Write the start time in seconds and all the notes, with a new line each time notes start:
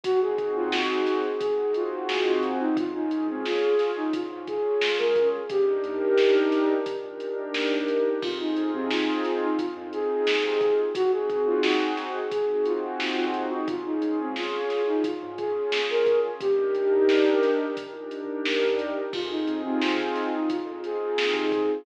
0.04 G#1 C4 D#4 F#4 G#4, kick, closed hi-hat
0.21 G#4
0.38 G#1, kick, closed hi-hat
0.56 D#2 F4
0.72 snare
1.07 snare, closed hi-hat
1.40 C4 D#4 F#4 G#4, kick, closed hi-hat
1.58 G#1
1.74 F4, closed hi-hat
2.09 snare
2.26 D#2 F4
2.43 closed hi-hat
2.60 D#4
2.76 C#2 C#4 F4 G#4, kick, closed hi-hat
2.94 D#4
3.11 C#2, closed hi-hat
3.27 C#2 C4
3.45 F4, snare
3.79 snare, closed hi-hat
3.96 D#4
4.13 C#4 F4 G#4, kick, closed hi-hat
4.30 G#2
4.47 G#4, kick, closed hi-hat
4.81 snare
4.98 C#2 A#4
5.16 kick, closed hi-hat
5.49 D#2 D4 D#4 G4 A#4, kick, closed hi-hat
5.84 D#2, closed hi-hat
6.02 D#2
6.18 snare
6.52 snare, closed hi-hat
6.86 D4 D#4 G4 A#4, kick, closed hi-hat
7.04 A#2
7.20 closed hi-hat
7.54 snare
7.72 D#2
7.88 closed hi-hat
8.22 F2 C4 D#4 F4 G#4, kick, crash
8.40 D#4
8.57 F2, closed hi-hat
8.74 C3 C4
8.90 F4, snare
9.25 snare, closed hi-hat
9.42 D#4
9.58 C4 D#4 F4 G#4, kick, closed hi-hat
9.77 F2
9.93 G#4, closed hi-hat
10.27 snare
10.44 C3 G#4
10.61 kick, closed hi-hat
10.95 G#1 C4 D#4 F#4 G#4, kick, closed hi-hat
11.12 G#4
11.28 G#1, kick, closed hi-hat
11.47 D#2 F4
11.63 snare
11.97 snare, closed hi-hat
12.32 C4 D#4 F#4 G#4, kick, closed hi-hat
12.50 G#1
12.65 F4, closed hi-hat
13.00 snare
13.17 D#2 F4
13.34 closed hi-hat
13.51 D#4
13.68 C#2 C#4 F4 G#4, kick, closed hi-hat
13.85 D#4
14.02 C#2, closed hi-hat
14.19 C#2 C4
14.36 F4, snare
14.70 snare, closed hi-hat
14.87 D#4
15.04 C#4 F4 G#4, kick, closed hi-hat
15.22 G#2
15.38 G#4, kick, closed hi-hat
15.72 snare
15.90 C#2 A#4
16.07 kick, closed hi-hat
16.40 D#2 D4 D#4 G4 A#4, kick, closed hi-hat
16.73 D#2, closed hi-hat
16.93 D#2
17.09 snare
17.43 snare, closed hi-hat
17.77 D4 D#4 G4 A#4, kick, closed hi-hat
17.93 A#2
18.11 closed hi-hat
18.45 snare
18.63 D#2
18.79 closed hi-hat
19.13 F2 C4 D#4 F4 G#4, kick, crash
19.30 D#4
19.47 F2, closed hi-hat
19.64 C3 C4
19.82 F4, snare
20.15 snare, closed hi-hat
20.33 D#4
20.49 C4 D#4 F4 G#4, kick, closed hi-hat
20.65 F2
20.84 G#4, closed hi-hat
21.18 snare
21.34 C3 G#4
21.52 kick, closed hi-hat